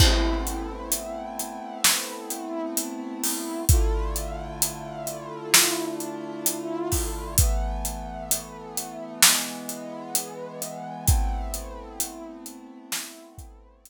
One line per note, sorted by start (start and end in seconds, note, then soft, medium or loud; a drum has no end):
0.00 3.64 A3 medium
0.00 3.64 B3 medium
0.00 3.64 C4 medium
0.00 3.64 E4 medium
0.00 kick loud
0.00 crash loud
0.47 closed hi-hat medium
0.92 closed hi-hat loud
1.39 closed hi-hat medium
1.84 snare loud
2.30 closed hi-hat medium
2.77 closed hi-hat loud
3.24 open hi-hat medium
3.69 7.36 D3 medium
3.69 7.36 A3 medium
3.69 7.36 E4 medium
3.69 7.36 F4 medium
3.69 kick loud
3.69 closed hi-hat loud
4.16 closed hi-hat medium
4.62 closed hi-hat loud
5.07 closed hi-hat medium
5.54 snare loud
6.00 closed hi-hat medium
6.46 closed hi-hat loud
6.92 kick medium
6.92 open hi-hat medium
7.38 9.21 E3 medium
7.38 9.21 A3 medium
7.38 9.21 B3 medium
7.38 kick loud
7.38 closed hi-hat loud
7.85 closed hi-hat medium
8.31 closed hi-hat loud
8.77 closed hi-hat medium
9.23 11.07 E3 medium
9.23 11.07 G#3 medium
9.23 11.05 B3 medium
9.23 snare loud
9.69 closed hi-hat medium
10.15 closed hi-hat loud
10.62 closed hi-hat medium
11.06 13.90 A3 medium
11.06 13.90 B3 medium
11.06 13.90 C4 medium
11.06 13.90 E4 medium
11.06 kick loud
11.06 closed hi-hat loud
11.54 closed hi-hat medium
12.00 closed hi-hat loud
12.46 closed hi-hat medium
12.92 snare loud
13.38 kick medium
13.38 closed hi-hat medium
13.85 closed hi-hat loud